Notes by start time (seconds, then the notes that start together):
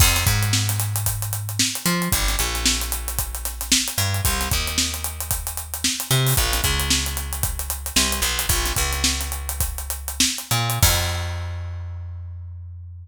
0.00 F2, kick, crash
0.16 snare, closed hi-hat
0.27 G#2, kick, closed hi-hat
0.43 closed hi-hat
0.53 snare
0.69 snare, closed hi-hat
0.80 snare, closed hi-hat
0.96 closed hi-hat
1.06 kick, closed hi-hat
1.22 closed hi-hat
1.33 closed hi-hat
1.49 closed hi-hat
1.59 snare
1.75 closed hi-hat
1.86 F3, closed hi-hat
2.02 closed hi-hat
2.12 G1, kick, closed hi-hat
2.28 snare, closed hi-hat
2.39 A#1, closed hi-hat
2.55 snare, closed hi-hat
2.65 snare
2.81 snare, closed hi-hat
2.92 closed hi-hat
3.08 closed hi-hat
3.19 kick, closed hi-hat
3.35 closed hi-hat
3.45 snare, closed hi-hat
3.61 snare, closed hi-hat
3.72 snare
3.88 closed hi-hat
3.98 G2, closed hi-hat
4.14 closed hi-hat
4.25 C2, kick, closed hi-hat
4.41 snare, closed hi-hat
4.51 D#2, kick, snare, closed hi-hat
4.67 snare, closed hi-hat
4.78 snare
4.94 closed hi-hat
5.04 closed hi-hat
5.20 closed hi-hat
5.31 kick, closed hi-hat
5.47 closed hi-hat
5.57 closed hi-hat
5.74 closed hi-hat
5.84 snare
6.00 snare, closed hi-hat
6.11 C3, closed hi-hat
6.27 open hi-hat
6.37 A#1, kick, closed hi-hat
6.53 snare, closed hi-hat
6.64 C#2, kick, closed hi-hat
6.80 closed hi-hat
6.90 snare
7.06 closed hi-hat
7.17 snare, closed hi-hat
7.33 closed hi-hat
7.43 kick, closed hi-hat
7.59 closed hi-hat
7.70 closed hi-hat
7.86 closed hi-hat
7.96 C2, snare
8.12 closed hi-hat
8.22 B1, closed hi-hat
8.39 closed hi-hat
8.49 A#1, kick, closed hi-hat
8.66 snare, closed hi-hat
8.76 C#2, kick, closed hi-hat
8.93 snare, closed hi-hat
9.04 snare
9.21 snare, closed hi-hat
9.32 closed hi-hat
9.49 closed hi-hat
9.60 kick, closed hi-hat
9.78 closed hi-hat
9.90 closed hi-hat
10.08 closed hi-hat
10.20 snare
10.38 closed hi-hat
10.51 A#2, snare, closed hi-hat
10.70 closed hi-hat
10.82 F2, kick, crash